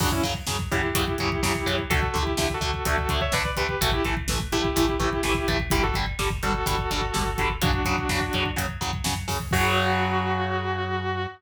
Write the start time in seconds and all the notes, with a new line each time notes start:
0.00 F#2 C#3 F#3 D4 F#4, kick, crash
0.12 C#4 E4, kick
0.22 F#2 C#3 F#3, kick, closed hi-hat
0.34 kick
0.47 F#2 C#3 F#3, kick, snare
0.59 kick
0.71 F#2 C#3 F#3 E4 G4, kick, closed hi-hat
0.83 kick
0.94 F#2 C#3 F#3, kick, closed hi-hat
1.08 kick
1.18 F#2 C#3 F#3, kick, closed hi-hat
1.32 kick
1.43 F#2 C#3 F#3, kick, snare
1.55 kick
1.66 F#2 C#3 F#3, kick, closed hi-hat
1.79 kick
1.90 D2 D3 A3 F#4 A4, kick, closed hi-hat
2.03 kick
2.14 D2 D3 A3, kick, closed hi-hat
2.22 E4 G4
2.27 kick
2.37 D2 D3 A3, kick, snare
2.50 kick
2.54 F#4 A4
2.61 D2 D3 A3, kick, closed hi-hat
2.74 kick
2.85 D2 D3 A3 F#4 A4, kick, closed hi-hat
2.98 kick
3.09 D2 D3 A3, kick, closed hi-hat
3.21 C#5 E5, kick
3.32 D2 D3 A3 B4 D5, kick, snare
3.45 kick
3.56 D2 D3 A3 G4 B4, kick, closed hi-hat
3.69 kick
3.81 A1 E3 A3 F#4 A4, kick, closed hi-hat
3.91 E4 G4, kick
4.05 A1 E3 A3, kick, closed hi-hat
4.17 kick
4.28 A1 E3 A3, kick, snare
4.39 kick
4.52 A1 E3 A3 E4 G4, kick, closed hi-hat
4.64 kick
4.76 A1 E3 A3, kick, closed hi-hat
4.89 kick
5.00 A1 E3 A3, kick, closed hi-hat
5.13 kick
5.23 A1 E3 A3, kick, snare
5.34 kick
5.48 A1 E3 A3, kick, closed hi-hat
5.60 kick
5.70 G1 D3 G3 E4 G4, kick, closed hi-hat
5.83 F#4 A4, kick
5.94 G1 D3 G3, kick, closed hi-hat
6.06 kick
6.19 G1 D3 G3, kick, snare
6.30 kick
6.43 G1 D3 G3 F#4 A4, kick, closed hi-hat
6.54 kick
6.66 G1 D3 G3, kick, closed hi-hat
6.79 kick
6.91 G1 D3 G3, kick, closed hi-hat
7.01 kick
7.14 G1 D3 G3, kick, snare
7.26 kick
7.38 G1 D3 G3, kick, closed hi-hat
7.50 kick
7.61 F#2 C#3 F#3 D4 F#4, kick, closed hi-hat
7.73 kick
7.85 F#2 C#3 F#3, kick, closed hi-hat
7.98 kick
8.09 F#2 C#3 F#3, kick, snare
8.21 kick
8.33 F#2 C#3 F#3, kick, closed hi-hat
8.46 kick
8.56 F#2 C#3 F#3, kick, closed hi-hat
8.68 kick
8.81 F#2 C#3 F#3, kick, closed hi-hat
8.93 kick
9.04 F#2 C#3 F#3, kick, snare
9.15 kick
9.28 F#2 C#3 F#3, kick, open hi-hat
9.40 kick
9.51 F#2 C#3 F#3 F#4, kick, crash